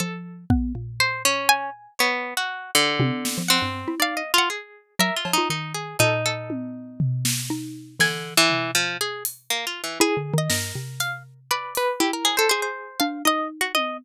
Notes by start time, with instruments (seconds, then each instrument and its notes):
0.00 xylophone F3, harpsichord A4
0.50 xylophone B3, kick
0.75 xylophone A#2
1.00 pizzicato strings C5
1.25 pizzicato strings C#4
1.49 harpsichord G#5
1.99 pizzicato strings B3, harpsichord C#5
2.37 pizzicato strings F#4
2.75 pizzicato strings D3
3.00 xylophone C3, high tom
3.25 snare
3.38 xylophone F3
3.48 pizzicato strings C4, harpsichord F#5
3.62 xylophone G2
3.88 xylophone E4
4.00 xylophone D#4, pizzicato strings D5, harpsichord F5
4.17 pizzicato strings D#5
4.34 pizzicato strings F4
4.38 harpsichord F#5
4.50 harpsichord G#4
4.99 xylophone F#3, pizzicato strings A#4, harpsichord E5
5.16 pizzicato strings F4
5.25 xylophone F3, cowbell
5.33 pizzicato strings D#4
5.38 xylophone F4
5.50 xylophone D#3, pizzicato strings D#4
5.74 pizzicato strings G#4
5.99 xylophone A#2, pizzicato strings D#4, harpsichord A4
6.26 harpsichord A4
6.50 high tom
7.00 floor tom
7.25 snare
7.50 xylophone D#4
7.99 pizzicato strings D3, xylophone E3, harpsichord G#5, snare
8.37 pizzicato strings E3
8.50 floor tom
8.75 pizzicato strings F3
9.01 pizzicato strings G#4
9.25 closed hi-hat
9.50 pizzicato strings A#3
9.67 pizzicato strings F4
9.84 pizzicato strings E3
10.00 xylophone E4, harpsichord G#4
10.17 xylophone D3
10.34 xylophone D#3
10.38 harpsichord D#5
10.50 xylophone G2, pizzicato strings A#4, snare
10.75 xylophone C3
11.00 harpsichord F5, closed hi-hat
11.51 harpsichord B4, pizzicato strings D5
11.75 harpsichord B4, closed hi-hat
12.00 pizzicato strings E4, xylophone E4, harpsichord G4
12.13 harpsichord A#4
12.25 pizzicato strings G#4, cowbell
12.37 harpsichord A4, pizzicato strings C5
12.49 harpsichord G#4, pizzicato strings C5
12.62 pizzicato strings C5
13.00 xylophone D4, harpsichord F5
13.25 xylophone D#4, pizzicato strings D#5, harpsichord D#5
13.61 harpsichord F#4
13.75 pizzicato strings D#5, high tom